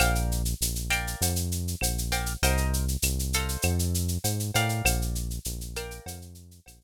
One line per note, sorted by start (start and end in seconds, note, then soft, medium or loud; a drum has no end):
0.00 0.55 A#1 medium
0.00 0.42 A#4 medium
0.00 0.42 D5 medium
0.00 0.42 F5 medium
0.00 0.42 G5 medium
0.00 cowbell medium
0.00 claves medium
0.00 shaker medium
0.15 shaker medium
0.32 shaker medium
0.45 shaker medium
0.61 1.15 A#1 medium
0.61 shaker medium
0.76 shaker medium
0.90 1.33 A#4 medium
0.90 1.33 D5 medium
0.90 1.33 F5 medium
0.90 1.33 G5 medium
0.90 claves medium
0.90 shaker medium
1.07 shaker medium
1.21 1.75 F2 medium
1.21 cowbell medium
1.21 shaker loud
1.36 shaker medium
1.52 shaker medium
1.68 shaker medium
1.81 2.36 A#1 medium
1.81 cowbell medium
1.81 claves medium
1.81 shaker medium
1.98 shaker medium
2.12 2.33 A#4 medium
2.12 2.33 D5 medium
2.12 2.33 F5 medium
2.12 2.33 G5 medium
2.12 cowbell medium
2.12 shaker medium
2.26 shaker medium
2.42 2.97 C2 medium
2.42 2.85 A#4 medium
2.42 2.85 C5 medium
2.42 2.85 D#5 medium
2.42 2.85 G5 loud
2.42 cowbell medium
2.42 shaker medium
2.57 shaker medium
2.73 shaker medium
2.88 shaker medium
3.02 3.57 C2 medium
3.02 claves medium
3.02 shaker loud
3.19 shaker medium
3.33 4.07 A4 medium
3.33 4.07 C5 medium
3.33 4.07 D#5 medium
3.33 4.07 F5 medium
3.33 shaker medium
3.49 shaker medium
3.62 4.18 F2 medium
3.62 cowbell medium
3.62 claves medium
3.62 shaker medium
3.79 shaker medium
3.94 shaker medium
4.08 shaker medium
4.24 4.51 G#2 medium
4.24 cowbell medium
4.24 shaker medium
4.40 shaker medium
4.54 4.82 A2 medium
4.54 5.28 A#4 medium
4.54 5.28 D5 medium
4.54 5.28 F5 loud
4.54 5.28 G5 medium
4.54 cowbell medium
4.54 shaker medium
4.69 shaker medium
4.85 5.39 A#1 medium
4.85 cowbell medium
4.85 claves loud
4.85 shaker medium
5.02 shaker medium
5.15 shaker medium
5.30 shaker medium
5.45 6.00 A#1 medium
5.45 shaker medium
5.61 shaker medium
5.76 6.19 A#4 medium
5.76 6.19 D5 medium
5.76 6.19 F5 medium
5.76 6.19 G5 medium
5.76 claves medium
5.76 shaker medium
5.91 shaker medium
6.06 6.60 F2 medium
6.06 cowbell medium
6.06 shaker medium
6.22 shaker medium
6.35 shaker medium
6.51 shaker medium
6.66 6.84 A#1 medium
6.66 cowbell medium
6.66 claves medium
6.66 shaker medium
6.81 shaker medium